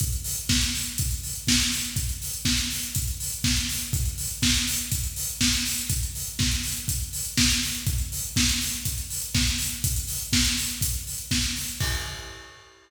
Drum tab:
CC |----------------|----------------|----------------|----------------|
HH |xxox-xoxxxox-xox|xxox-xoxxxox-xox|xxox-xoxxxox-xox|xxox-xoxxxox-xox|
SD |----o-------o---|----o-------o---|----o-------o---|----o-------o---|
BD |o---o---o---o---|o---o---o---o---|o---o---o---o---|o---o---o---o---|

CC |----------------|----------------|x---------------|
HH |xxox-xoxxxox-xox|xxox-xoxxxox-xox|----------------|
SD |----o-------o---|----o-------o---|----------------|
BD |o---o---o---o---|o---o---o---o---|o---------------|